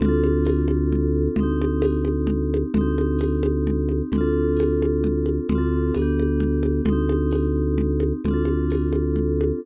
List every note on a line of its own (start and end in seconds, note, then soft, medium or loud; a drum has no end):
0.00 1.28 D2 medium
0.00 1.35 C4 medium
0.00 1.35 D4 medium
0.00 low conga loud
0.06 1.35 F4 medium
0.06 1.35 A4 medium
0.24 high conga medium
0.45 tambourine medium
0.45 high conga loud
0.68 high conga medium
0.92 low conga medium
1.36 2.64 D2 medium
1.36 2.72 C4 medium
1.36 low conga loud
1.40 2.72 D#4 medium
1.40 2.72 G4 medium
1.62 high conga medium
1.82 tambourine loud
1.82 high conga loud
2.05 high conga medium
2.27 low conga loud
2.54 high conga loud
2.74 4.02 D2 medium
2.74 4.10 C4 medium
2.74 4.10 D#4 medium
2.74 low conga loud
2.81 4.10 G4 medium
2.98 high conga medium
3.19 tambourine medium
3.19 high conga medium
3.43 high conga loud
3.67 low conga loud
3.89 high conga medium
4.12 5.40 D2 medium
4.12 5.47 C4 medium
4.12 5.47 D4 medium
4.12 low conga loud
4.18 5.47 F4 medium
4.18 5.47 A4 medium
4.57 tambourine medium
4.57 high conga medium
4.82 high conga medium
5.04 low conga loud
5.26 high conga medium
5.49 5.92 D2 medium
5.49 5.94 C4 medium
5.49 5.94 D4 medium
5.49 low conga loud
5.55 5.94 F4 medium
5.55 5.94 A4 medium
5.94 6.81 D2 medium
5.94 6.86 B3 medium
5.94 tambourine medium
5.94 high conga medium
5.99 6.86 D4 medium
5.99 6.86 G4 medium
6.19 high conga medium
6.40 low conga loud
6.63 high conga medium
6.85 8.13 D2 medium
6.85 8.22 C4 medium
6.85 low conga loud
6.90 8.22 D#4 medium
6.90 8.22 G4 medium
7.09 high conga medium
7.31 tambourine medium
7.31 high conga medium
7.78 low conga loud
8.00 high conga medium
8.24 9.52 D2 medium
8.24 9.60 C4 medium
8.24 9.60 D4 medium
8.24 low conga loud
8.31 9.60 F4 medium
8.31 9.60 A4 medium
8.45 high conga medium
8.70 tambourine loud
8.70 high conga medium
8.93 high conga medium
9.16 low conga medium
9.41 high conga medium